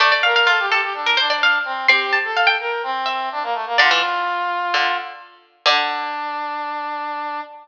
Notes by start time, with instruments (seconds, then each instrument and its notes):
0.00 pizzicato strings A3, brass section D5, harpsichord D5
0.12 harpsichord D5
0.23 brass section A#4, harpsichord F5
0.36 harpsichord F5
0.47 harpsichord F4, brass section A4
0.59 brass section G4
0.70 brass section G4, harpsichord A4
0.82 brass section G4
0.94 brass section D4
1.06 harpsichord A#4
1.17 brass section D4, harpsichord C5
1.30 harpsichord D5
1.43 harpsichord F5
1.65 brass section C4
1.88 pizzicato strings C4, brass section G4, harpsichord C6
2.13 harpsichord A5
2.24 brass section A4
2.37 harpsichord F5
2.47 harpsichord G5
2.60 brass section A#4
2.83 brass section C4
3.06 harpsichord E5
3.32 brass section D4
3.43 brass section A#3
3.54 brass section A3
3.66 brass section A#3
3.78 pizzicato strings D3, brass section F4, harpsichord D5
3.91 pizzicato strings E3
4.74 pizzicato strings D3
5.66 pizzicato strings D3, brass section D4, harpsichord D5